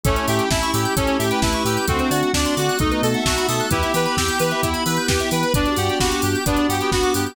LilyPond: <<
  \new Staff \with { instrumentName = "Lead 2 (sawtooth)" } { \time 4/4 \key g \major \tempo 4 = 131 cis'8 g'8 e'8 g'8 cis'8 g'8 e'8 g'8 | c'8 fis'8 d'8 fis'8 dis'8 a'8 fis'8 a'8 | e'8 b'8 g'8 b'8 e'8 b'8 g'8 b'8 | d'8 g'8 fis'8 g'8 d'8 g'8 fis'8 g'8 | }
  \new Staff \with { instrumentName = "Clarinet" } { \time 4/4 \key g \major a4 e'4 a'8. b'4~ b'16 | fis'4 d''4 dis''8. e''4~ e''16 | g'2~ g'8 r4. | d''4 g'4 b8. b4~ b16 | }
  \new Staff \with { instrumentName = "Electric Piano 2" } { \time 4/4 \key g \major <a cis' e' g'>2 <a cis' e' g'>2 | <a c' d' fis'>4 <a c' d' fis'>4 <a b dis' fis'>4 <a b dis' fis'>4 | <b e' g'>2 <b e' g'>2 | <b d' fis' g'>2 <b d' fis' g'>2 | }
  \new Staff \with { instrumentName = "Electric Piano 2" } { \time 4/4 \key g \major a'16 cis''16 e''16 g''16 a''16 cis'''16 e'''16 g'''16 a'16 cis''16 e''16 g''16 a''16 cis'''16 e'''16 g'''16 | a'16 c''16 d''16 fis''16 a''16 c'''16 d'''16 fis'''16 a'16 b'16 dis''16 fis''16 a''16 b''16 dis'''16 fis'''16 | b'16 e''16 g''16 b''16 e'''16 g'''16 b'16 e''16 g''16 b''16 e'''16 g'''16 b'16 e''16 g''16 b''16 | b'16 d''16 fis''16 g''16 b''16 d'''16 fis'''16 g'''16 b'16 d''16 fis''16 g''16 b''16 d'''16 fis'''16 g'''16 | }
  \new Staff \with { instrumentName = "Synth Bass 2" } { \clef bass \time 4/4 \key g \major a,,8 a,8 a,,8 a,8 a,,8 a,8 a,,8 a,8 | d,8 d8 d,8 d8 b,,8 b,8 b,,8 b,8 | e,8 e8 e,8 e8 e,8 e8 e,8 e8 | g,,8 g,8 g,,8 g,8 g,,8 g,8 g,,8 g,8 | }
  \new Staff \with { instrumentName = "Pad 5 (bowed)" } { \time 4/4 \key g \major <a cis' e' g'>1 | <a c' d' fis'>2 <a b dis' fis'>2 | <b e' g'>1 | <b d' fis' g'>1 | }
  \new DrumStaff \with { instrumentName = "Drums" } \drummode { \time 4/4 <hh bd>16 hh16 hho16 hh16 <bd sn>16 hh16 hho16 hh16 <hh bd>16 hh16 hho16 hh16 <bd sn>16 hh16 hho16 hh16 | <hh bd>16 hh16 hho16 hh16 <bd sn>16 hh16 hho16 hh16 <hh bd>16 hh16 hho16 hh16 <bd sn>16 hh16 hho16 hh16 | <hh bd>16 hh16 hho16 hh16 <bd sn>16 hh16 hho16 hh16 <hh bd>16 hh16 hho16 hh16 <bd sn>16 hh16 hho16 hh16 | <hh bd>16 hh16 hho16 hh16 <bd sn>16 hh16 hho16 hh16 <hh bd>16 hh16 hho16 hh16 <bd sn>16 hh16 hho16 hh16 | }
>>